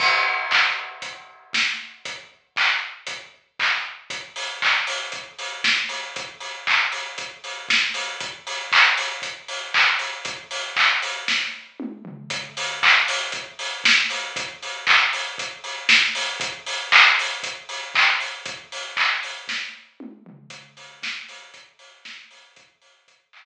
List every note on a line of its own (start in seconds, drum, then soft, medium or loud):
0.00 kick medium
0.00 crash medium
0.51 kick medium
0.51 clap medium
1.02 kick medium
1.02 closed hi-hat medium
1.53 kick medium
1.53 snare medium
2.05 kick medium
2.05 closed hi-hat medium
2.56 kick medium
2.56 clap medium
3.07 kick medium
3.07 closed hi-hat medium
3.59 kick medium
3.59 clap medium
4.10 kick medium
4.10 closed hi-hat medium
4.36 open hi-hat medium
4.62 kick medium
4.62 clap medium
4.87 open hi-hat medium
5.12 kick medium
5.12 closed hi-hat medium
5.39 open hi-hat medium
5.64 kick medium
5.64 snare medium
5.89 open hi-hat medium
6.16 kick medium
6.16 closed hi-hat medium
6.40 open hi-hat medium
6.67 kick medium
6.67 clap medium
6.92 open hi-hat medium
7.18 kick medium
7.18 closed hi-hat medium
7.44 open hi-hat medium
7.69 kick medium
7.69 snare medium
7.94 open hi-hat medium
8.20 kick medium
8.20 closed hi-hat medium
8.47 open hi-hat medium
8.72 kick medium
8.72 clap loud
8.97 open hi-hat medium
9.22 kick medium
9.22 closed hi-hat medium
9.48 open hi-hat medium
9.74 kick medium
9.74 clap medium
9.99 open hi-hat medium
10.25 kick medium
10.25 closed hi-hat medium
10.51 open hi-hat medium
10.76 kick medium
10.76 clap medium
11.02 open hi-hat medium
11.28 kick medium
11.28 snare medium
11.80 mid tom medium
12.05 floor tom medium
12.30 kick medium
12.30 closed hi-hat medium
12.57 open hi-hat medium
12.83 kick medium
12.83 clap medium
13.08 open hi-hat medium
13.32 kick medium
13.32 closed hi-hat medium
13.59 open hi-hat medium
13.84 kick medium
13.84 snare loud
14.10 open hi-hat medium
14.36 kick medium
14.36 closed hi-hat medium
14.63 open hi-hat medium
14.87 kick medium
14.87 clap medium
15.13 open hi-hat medium
15.38 kick medium
15.38 closed hi-hat medium
15.64 open hi-hat medium
15.89 kick medium
15.89 snare loud
16.15 open hi-hat medium
16.40 kick loud
16.40 closed hi-hat loud
16.66 open hi-hat medium
16.92 kick medium
16.92 clap loud
17.19 open hi-hat medium
17.43 kick medium
17.43 closed hi-hat loud
17.69 open hi-hat medium
17.95 kick medium
17.95 clap loud
18.20 open hi-hat medium
18.46 kick loud
18.46 closed hi-hat loud
18.72 open hi-hat medium
18.97 kick medium
18.97 clap loud
19.23 open hi-hat medium
19.48 kick medium
19.48 snare medium
20.00 mid tom medium
20.26 floor tom medium
20.50 kick medium
20.50 closed hi-hat medium
20.77 kick medium
20.77 open hi-hat medium
21.03 kick medium
21.03 snare loud
21.29 open hi-hat medium
21.54 kick medium
21.54 closed hi-hat medium
21.79 open hi-hat medium
22.05 kick medium
22.05 snare medium
22.31 open hi-hat medium
22.56 kick loud
22.56 closed hi-hat medium
22.82 open hi-hat medium
23.08 kick medium
23.08 closed hi-hat medium
23.33 clap loud